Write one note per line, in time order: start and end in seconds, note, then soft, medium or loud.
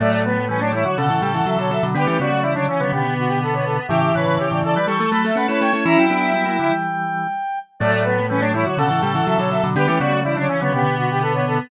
0.00 0.85 A2 medium
0.00 0.39 F#3 medium
0.00 0.22 A3 loud
0.00 0.39 A3 medium
0.00 0.11 D5 medium
0.11 0.23 D5 medium
0.25 0.45 B3 medium
0.25 0.48 B4 medium
0.48 0.60 E3 medium
0.48 0.60 G3 medium
0.48 0.61 C#4 medium
0.48 0.60 B4 medium
0.61 0.72 F#3 medium
0.61 0.72 A3 medium
0.61 0.72 D4 medium
0.61 0.72 C#5 medium
0.72 0.84 E3 medium
0.72 0.84 G3 medium
0.72 0.85 E4 medium
0.72 0.84 C#5 medium
0.84 0.97 D3 medium
0.84 0.97 F#3 medium
0.84 0.96 F#4 medium
0.84 0.97 C#5 medium
0.97 1.09 B2 medium
0.97 1.09 C#3 medium
0.97 1.09 D3 medium
0.97 1.86 A4 medium
0.97 1.22 F#5 medium
1.10 1.21 A2 medium
1.10 1.21 C#3 medium
1.10 1.22 E3 medium
1.21 1.41 A2 medium
1.21 1.41 C#3 medium
1.21 1.34 G3 medium
1.21 1.32 G5 medium
1.34 1.46 E3 medium
1.34 1.46 F#5 medium
1.46 1.57 C#3 medium
1.46 1.57 E3 medium
1.46 1.58 F#3 medium
1.46 1.58 E5 medium
1.58 1.80 B2 medium
1.58 1.80 D3 medium
1.58 1.70 F#3 medium
1.58 1.71 C#5 medium
1.71 1.82 F#3 medium
1.71 1.83 E5 medium
1.83 1.95 B2 medium
1.83 1.95 D3 medium
1.83 1.95 F#3 medium
1.94 2.07 D3 loud
1.94 2.06 G3 medium
1.94 2.06 B3 medium
1.94 2.19 G4 loud
1.94 2.07 B4 medium
2.07 2.19 E3 medium
2.07 2.18 A3 medium
2.07 2.18 C#4 medium
2.07 2.19 B4 medium
2.19 3.06 C#3 medium
2.19 2.31 G3 medium
2.19 2.31 B3 medium
2.19 2.41 F#4 loud
2.19 2.40 D5 medium
2.32 2.43 F#3 medium
2.32 2.43 A3 medium
2.42 2.55 E3 medium
2.42 2.55 G3 medium
2.42 2.54 E4 medium
2.42 2.53 D5 medium
2.54 2.68 D3 medium
2.54 2.68 F#3 medium
2.54 2.66 D4 medium
2.54 2.66 C#5 medium
2.68 2.80 C#3 medium
2.68 2.80 E3 medium
2.68 2.80 C#4 medium
2.68 2.79 C#5 medium
2.79 2.92 D3 medium
2.79 2.92 F#3 medium
2.79 2.91 B3 medium
2.79 2.91 C#5 medium
2.92 3.80 B2 medium
2.92 3.80 D3 medium
2.92 3.87 B3 medium
2.92 3.14 G4 medium
3.18 3.29 F#4 medium
3.28 3.39 G4 medium
3.43 3.54 A4 medium
3.53 3.65 C#5 medium
3.65 3.77 A4 medium
3.88 4.12 A2 medium
3.88 4.12 C#3 medium
3.88 4.78 E3 medium
3.88 4.12 G4 loud
3.88 3.99 E5 medium
4.04 4.15 E5 medium
4.14 4.26 A2 medium
4.14 4.26 C#3 medium
4.14 4.38 B4 medium
4.14 4.35 C#5 medium
4.27 4.38 A2 medium
4.27 4.38 C#3 medium
4.37 4.50 C#3 medium
4.37 4.50 E3 medium
4.37 4.60 G4 medium
4.37 4.48 C#5 medium
4.51 4.63 A2 medium
4.51 4.63 C#3 medium
4.51 4.64 D5 medium
4.64 4.75 C#3 medium
4.64 4.75 E3 medium
4.64 4.76 A4 medium
4.64 4.74 D5 medium
4.75 4.87 E3 medium
4.75 4.87 G3 medium
4.75 4.87 B4 medium
4.75 4.86 D5 medium
4.87 5.07 E3 medium
4.87 5.07 G3 medium
4.87 4.99 G3 medium
4.87 4.98 A4 medium
4.87 5.09 C#6 medium
4.99 5.12 A3 medium
4.99 5.34 A4 medium
5.11 5.31 F#3 medium
5.11 5.31 A3 medium
5.11 5.24 A3 medium
5.11 5.23 B5 medium
5.24 5.36 A3 medium
5.24 5.37 E5 medium
5.35 5.47 A3 medium
5.35 5.48 A3 medium
5.35 5.47 C#4 medium
5.35 5.48 B4 medium
5.35 5.47 F#5 medium
5.48 5.60 A3 medium
5.48 5.71 C#4 medium
5.48 5.71 E4 medium
5.48 5.61 B4 medium
5.48 5.60 C#5 medium
5.61 5.73 A3 medium
5.61 5.83 C#5 medium
5.61 5.72 G5 medium
5.73 5.85 A3 medium
5.73 5.84 C#4 medium
5.73 5.84 E4 medium
5.84 5.97 E3 medium
5.84 6.06 C#4 medium
5.84 6.72 E4 loud
5.84 6.06 E4 loud
5.84 5.98 A#5 medium
5.97 6.09 F#3 medium
5.97 7.59 G5 medium
6.10 6.68 F#3 medium
6.10 6.32 B3 medium
6.10 6.32 D4 medium
6.34 6.45 G3 medium
6.34 6.45 B3 medium
6.46 6.57 F#3 medium
6.46 6.57 A#3 medium
6.59 6.71 D3 medium
6.59 6.71 F#3 medium
6.71 7.27 E3 medium
6.71 7.27 G3 medium
7.80 8.65 A2 loud
7.80 8.20 F#3 medium
7.80 8.20 A3 medium
7.80 8.03 A3 loud
7.80 7.91 D5 medium
7.93 8.05 D5 medium
8.03 8.26 B3 medium
8.03 8.26 B4 medium
8.29 8.41 E3 medium
8.29 8.41 G3 medium
8.29 8.42 C#4 medium
8.29 8.41 B4 medium
8.40 8.53 F#3 medium
8.40 8.53 A3 medium
8.40 8.52 D4 loud
8.40 8.52 C#5 medium
8.53 8.65 E3 medium
8.53 8.65 G3 medium
8.53 8.66 E4 medium
8.53 8.65 C#5 medium
8.64 8.77 D3 medium
8.64 8.78 F#3 medium
8.64 8.76 F#4 medium
8.64 8.77 C#5 medium
8.77 8.89 B2 medium
8.77 8.90 C#3 medium
8.77 8.89 D3 medium
8.77 9.67 A4 medium
8.77 9.02 F#5 medium
8.90 9.02 A2 medium
8.90 9.02 C#3 medium
8.90 9.02 E3 medium
9.00 9.22 A2 medium
9.00 9.22 C#3 medium
9.00 9.14 G3 medium
9.00 9.12 G5 medium
9.14 9.26 E3 medium
9.14 9.25 F#5 medium
9.27 9.39 C#3 medium
9.27 9.39 E3 medium
9.27 9.38 F#3 medium
9.27 9.38 E5 medium
9.38 9.60 B2 medium
9.38 9.60 D3 medium
9.38 9.51 F#3 medium
9.38 9.50 C#5 medium
9.51 9.63 F#3 medium
9.51 9.62 E5 medium
9.63 9.75 B2 medium
9.63 9.75 D3 medium
9.63 9.75 F#3 medium
9.75 9.87 D3 loud
9.75 9.88 G3 medium
9.75 9.88 B3 medium
9.75 9.98 G4 loud
9.75 9.86 B4 medium
9.87 9.99 E3 medium
9.87 9.99 A3 medium
9.87 9.99 C#4 medium
9.87 9.99 B4 medium
9.99 10.87 C#3 medium
9.99 10.12 G3 medium
9.99 10.12 B3 medium
9.99 10.20 F#4 loud
9.99 10.20 D5 medium
10.12 10.24 F#3 medium
10.12 10.24 A3 medium
10.23 10.37 E3 medium
10.23 10.37 G3 medium
10.23 10.36 E4 medium
10.23 10.35 D5 medium
10.35 10.48 D3 medium
10.35 10.48 F#3 medium
10.35 10.47 D4 loud
10.35 10.49 C#5 medium
10.49 10.61 C#3 medium
10.49 10.61 E3 medium
10.49 10.60 C#4 medium
10.49 10.60 C#5 medium
10.60 10.72 D3 medium
10.60 10.73 F#3 medium
10.60 10.73 B3 loud
10.60 10.72 C#5 medium
10.72 11.60 B2 medium
10.72 11.60 D3 medium
10.72 11.68 B3 loud
10.72 10.95 G4 medium
10.98 11.10 F#4 medium
11.11 11.22 G4 medium
11.21 11.33 A4 medium
11.34 11.45 C#5 medium
11.47 11.59 A4 medium